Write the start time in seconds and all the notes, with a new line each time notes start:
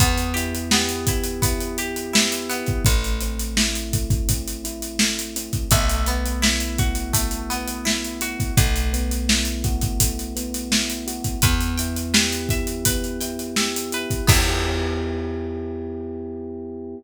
0.00 E2 B3, kick, closed hi-hat
0.18 closed hi-hat
0.34 E4 G4, closed hi-hat
0.55 closed hi-hat
0.71 B3 G4, snare
0.89 closed hi-hat
1.07 B3 E4, kick, closed hi-hat
1.24 closed hi-hat
1.42 B3 E4, kick, closed hi-hat
1.60 closed hi-hat
1.78 G4, closed hi-hat
1.96 closed hi-hat
2.13 B3 E4, snare
2.32 closed hi-hat
2.50 B3 E4, closed hi-hat
2.67 kick, closed hi-hat
2.85 A1 A3, kick, closed hi-hat
3.04 closed hi-hat
3.21 C4, closed hi-hat
3.39 closed hi-hat
3.57 E4, snare
3.75 closed hi-hat
3.93 A3, kick, closed hi-hat
4.10 kick, closed hi-hat
4.29 C4, kick, closed hi-hat
4.48 closed hi-hat
4.64 E4, closed hi-hat
4.82 closed hi-hat
4.99 A3, snare
5.19 closed hi-hat
5.36 C4, closed hi-hat
5.53 kick, closed hi-hat
5.71 B1 A3, kick, closed hi-hat
5.89 closed hi-hat
6.06 B3, closed hi-hat
6.26 closed hi-hat
6.42 E4, snare
6.60 closed hi-hat
6.78 F#4, kick, closed hi-hat
6.95 closed hi-hat
7.13 A3, kick, closed hi-hat
7.31 closed hi-hat
7.50 B3, closed hi-hat
7.68 closed hi-hat
7.85 E4, snare
8.04 closed hi-hat
8.21 F#4, closed hi-hat
8.40 kick, closed hi-hat
8.57 B1 A3, kick, closed hi-hat
8.76 closed hi-hat
8.93 B3, closed hi-hat
9.11 closed hi-hat
9.28 E4, snare
9.45 closed hi-hat
9.64 F#4, kick, closed hi-hat
9.81 kick, closed hi-hat
10.00 A3, kick, closed hi-hat
10.19 closed hi-hat
10.36 B3, closed hi-hat
10.54 closed hi-hat
10.71 E4, snare
10.90 closed hi-hat
11.07 F#4, closed hi-hat
11.24 kick, closed hi-hat
11.42 E2 B3 B4, kick, closed hi-hat
11.61 closed hi-hat
11.78 E4 G5, closed hi-hat
11.96 closed hi-hat
12.14 G4 B4, snare
12.32 closed hi-hat
12.49 E4 E5, kick, closed hi-hat
12.67 closed hi-hat
12.85 B3 B4, kick, closed hi-hat
13.04 closed hi-hat
13.21 E4 G5, closed hi-hat
13.39 closed hi-hat
13.56 G4 E5, snare
13.76 closed hi-hat
13.92 E4 B4, closed hi-hat
14.10 kick, closed hi-hat
14.27 E2 B3 E4 G4, kick, crash
14.32 G4